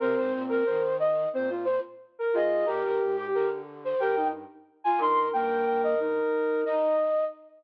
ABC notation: X:1
M:4/4
L:1/16
Q:1/4=90
K:Cm
V:1 name="Flute"
c3 B c2 e2 z2 c z3 A2 | B2 z2 B z2 c g2 z3 a c'2 | g2 g e z4 e4 z4 |]
V:2 name="Flute"
B c z B2 z3 c z4 B e2 | G B z G2 z3 B z4 F B2 | B8 E2 z6 |]
V:3 name="Flute"
C4 z4 C F z4 F2 | G4 z4 G E z4 E2 | B,4 E4 z8 |]
V:4 name="Flute" clef=bass
C, A,, B,,2 E,4 B,,3 z3 A,,2 | B,, G,, A,,2 D,4 G,,3 z3 G,,2 | G,,2 G,,4 z10 |]